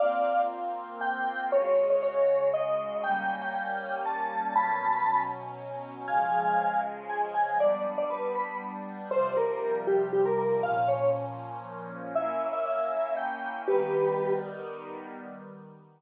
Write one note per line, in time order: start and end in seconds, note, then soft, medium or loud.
0.00 1.50 A#3 medium
0.00 1.50 C4 medium
0.00 1.50 F4 medium
0.00 0.42 D5 medium
0.00 0.42 F5 medium
1.01 1.44 G5 medium
1.52 3.02 C#3 medium
1.52 3.02 G#3 medium
1.52 3.02 F#4 medium
1.52 1.86 C#5 loud
1.90 2.02 C#5 medium
2.03 2.49 C#5 medium
2.54 3.01 D#5 medium
3.03 4.53 G3 medium
3.03 4.53 A#3 medium
3.03 4.53 C#4 medium
3.03 3.35 G5 loud
3.41 3.53 G5 medium
3.55 4.01 G5 medium
4.05 4.53 A5 medium
4.55 6.06 B2 medium
4.55 6.06 F#3 medium
4.55 6.06 C#4 medium
4.55 5.20 A5 medium
4.55 5.20 B5 loud
6.08 7.58 C#3 medium
6.08 7.58 F3 medium
6.08 7.58 G#3 loud
6.08 6.81 F5 medium
6.08 6.81 G#5 medium
7.09 7.21 G#5 medium
7.34 7.58 G#5 medium
7.58 9.09 G3 medium
7.58 9.09 B3 medium
7.58 9.09 D4 medium
7.58 7.82 D5 loud
7.98 8.10 D5 medium
8.10 8.33 B4 medium
8.35 8.57 B5 medium
9.11 10.62 C3 medium
9.11 10.62 F3 medium
9.11 10.62 G3 medium
9.11 9.33 C5 loud
9.37 9.79 A#4 medium
9.87 10.09 G4 medium
10.13 10.25 G4 medium
10.25 10.37 A#4 medium
10.38 10.61 A#4 medium
10.63 12.13 A#2 medium
10.63 12.13 F3 medium
10.63 12.13 C#4 medium
10.63 10.88 F5 loud
10.88 11.10 C#5 medium
12.15 13.65 A#3 medium
12.15 13.65 C#4 medium
12.15 13.65 E4 medium
12.15 12.47 E5 medium
12.53 12.65 E5 loud
12.66 13.15 E5 medium
13.17 13.62 G5 medium
13.68 15.18 D#3 loud
13.68 15.18 G3 medium
13.68 15.18 B3 medium
13.68 14.33 G4 medium
13.68 14.33 B4 medium